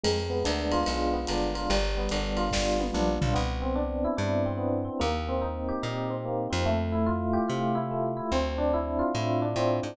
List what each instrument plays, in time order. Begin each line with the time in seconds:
0.04 electric bass (finger) F2, electric piano 1 G#3, ride
0.30 electric piano 1 B3
0.44 electric bass (finger) D2, electric piano 1 D4, hi-hat pedal, ride
0.72 electric piano 1 F4, ride
0.86 electric bass (finger) B1, electric piano 1 G#3, ride
1.13 electric piano 1 B3
1.27 electric bass (finger) G1, electric piano 1 D4, hi-hat pedal, ride
1.55 electric piano 1 F4, ride
1.70 electric bass (finger) G1, electric piano 1 G3, ride
1.97 electric piano 1 B3
2.09 electric bass (finger) G1, electric piano 1 D4, hi-hat pedal, ride
2.37 electric piano 1 F4, ride
2.51 electric bass (finger) G1, electric piano 1 G3, kick, snare
2.79 electric piano 1 B3, high tom
2.94 electric bass (finger) A#1, electric piano 1 D4, mid tom
3.21 electric bass (finger) B1, electric piano 1 F4, floor tom
3.34 electric bass (finger) C2, electric piano 1 B3
3.62 electric piano 1 C4
3.76 electric piano 1 D4
4.04 electric piano 1 E4
4.17 electric bass (finger) G2, electric piano 1 D4
4.46 electric piano 1 C4
4.57 electric piano 1 B3
4.85 electric piano 1 C4
5.00 electric bass (finger) D#2, electric piano 1 A#3
5.29 electric piano 1 C4
5.42 electric piano 1 D#4
5.69 electric piano 1 G4
5.83 electric bass (finger) A#2, electric piano 1 D#4
6.10 electric piano 1 C4
6.25 electric piano 1 A#3
6.50 electric bass (finger) F2, electric piano 1 C4
6.66 electric piano 1 A3
6.92 electric piano 1 E4
7.06 electric piano 1 F4
7.33 electric piano 1 G4
7.48 electric bass (finger) C3, electric piano 1 F4
7.75 electric piano 1 E4
7.91 electric piano 1 A3
8.17 electric piano 1 E4
8.32 electric bass (finger) D2, electric piano 1 C4
8.58 electric piano 1 D4
8.74 electric piano 1 E4
8.99 electric piano 1 F4
9.15 electric bass (finger) A2, electric piano 1 E4
9.42 electric piano 1 D4
9.56 electric bass (finger) A2, electric piano 1 C4
9.83 electric bass (finger) G#2, electric piano 1 D4